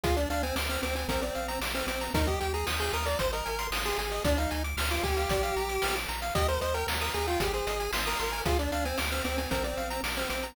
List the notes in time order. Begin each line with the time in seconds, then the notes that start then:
0.04 D2 F4 G#4, kick, closed hi-hat
0.16 D4 D5, closed hi-hat
0.30 D2 D4 F5, closed hi-hat
0.43 C4 G#5, closed hi-hat
0.56 D2 D6, snare
0.69 C4 F6, closed hi-hat
0.83 D2 C4 D6, closed hi-hat
0.96 C4 G#5, closed hi-hat
1.08 A#1 C4 A#4, kick, closed hi-hat
1.21 C4 D5, closed hi-hat
1.35 A#1 F5, closed hi-hat
1.48 A#5, closed hi-hat
1.61 A#1 D6, snare
1.74 C4 F6, closed hi-hat
1.87 A#1 C4 D6, closed hi-hat
2.01 A#5, closed hi-hat
2.14 D#2 D#4 A#4, kick, closed hi-hat
2.27 G4 D#5, kick, closed hi-hat
2.40 D#2 G4 G5, closed hi-hat
2.54 G#4 A#5, closed hi-hat
2.67 D#2 D#6, snare
2.80 G#4 G6, closed hi-hat
2.93 D#2 A#4 D#6, closed hi-hat
3.06 D5 A#5, closed hi-hat
3.19 G#1 C5, kick, closed hi-hat
3.32 A#4 D#5, closed hi-hat
3.46 G#1 G#5, closed hi-hat
3.59 C6, closed hi-hat
3.71 G#1 D#6, snare
3.85 G#4 C6, closed hi-hat
3.98 G#1 G#4 G#5, closed hi-hat
4.11 D#5, closed hi-hat
4.25 D2 D4 D5, kick, closed hi-hat
4.38 D#4 F5, closed hi-hat
4.51 D2 G#5, closed hi-hat
4.64 D6, closed hi-hat
4.77 D2 F6, snare
4.91 F4 D6, closed hi-hat
5.03 D2 G4 G#5, kick, closed hi-hat
5.17 F5, closed hi-hat
5.29 A#1 D5, kick, closed hi-hat
5.43 F5, closed hi-hat
5.56 A#1 A#5, closed hi-hat
5.69 D6, closed hi-hat
5.82 A#1 F6, snare
5.96 D6, closed hi-hat
6.09 A#1 A#5, closed hi-hat
6.22 F5, closed hi-hat
6.35 D#2 G4 D#5, kick, closed hi-hat
6.48 A#4 C5, closed hi-hat
6.61 D#2 C5 D#5, closed hi-hat
6.74 A#4 G5, closed hi-hat
6.87 D#2 A#5, snare
7.01 A#4 D#6, closed hi-hat
7.14 D#2 G#4 A#5, closed hi-hat
7.27 F4 G5, closed hi-hat
7.40 G#1 G4 G#4, kick, closed hi-hat
7.53 G#4 C5, closed hi-hat
7.67 G#1 D#5, closed hi-hat
7.80 G#5, closed hi-hat
7.93 G#1 C6, snare
8.06 A#4 D#6, closed hi-hat
8.19 G#1 A#4 C6, closed hi-hat
8.32 G#5, closed hi-hat
8.46 D2 F4 G#4, kick, closed hi-hat
8.59 D4 D5, closed hi-hat
8.71 D2 D4 F5, closed hi-hat
8.85 C4 G#5, closed hi-hat
8.98 D2 D6, snare
9.12 C4 F6, closed hi-hat
9.24 D2 C4 D6, closed hi-hat
9.38 C4 G#5, closed hi-hat
9.51 A#1 C4 A#4, kick, closed hi-hat
9.64 C4 D5, closed hi-hat
9.77 A#1 F5, closed hi-hat
9.90 A#5, closed hi-hat
10.03 A#1 D6, snare
10.17 C4 F6, closed hi-hat
10.30 A#1 C4 D6, closed hi-hat
10.43 A#5, closed hi-hat